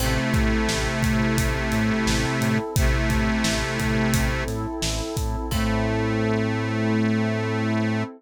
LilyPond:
<<
  \new Staff \with { instrumentName = "Harmonica" } { \time 4/4 \key a \minor \tempo 4 = 87 <c a>1 | <c a>2~ <c a>8 r4. | a1 | }
  \new Staff \with { instrumentName = "Electric Piano 1" } { \time 4/4 \key a \minor c'8 a'8 e'8 a'8 c'8 a'8 e'8 a'8 | c'8 a'8 e'8 a'8 c'8 a'8 e'8 a'8 | <c' e' a'>1 | }
  \new Staff \with { instrumentName = "Synth Bass 1" } { \clef bass \time 4/4 \key a \minor a,,8 a,8 a,,8 a,8 a,,8 a,8 a,,8 a,8 | a,,8 a,8 a,,8 a,8 a,,8 a,8 a,,8 a,8 | a,1 | }
  \new Staff \with { instrumentName = "Pad 2 (warm)" } { \time 4/4 \key a \minor <c' e' a'>1~ | <c' e' a'>1 | <c' e' a'>1 | }
  \new DrumStaff \with { instrumentName = "Drums" } \drummode { \time 4/4 cymc8 <hh bd>8 sn8 <hh bd>8 <hh bd>8 hh8 sn8 hh8 | <hh bd>8 <hh bd>8 sn8 <hh bd>8 <hh bd>8 <hh sn>8 sn8 <hh bd>8 | <cymc bd>4 r4 r4 r4 | }
>>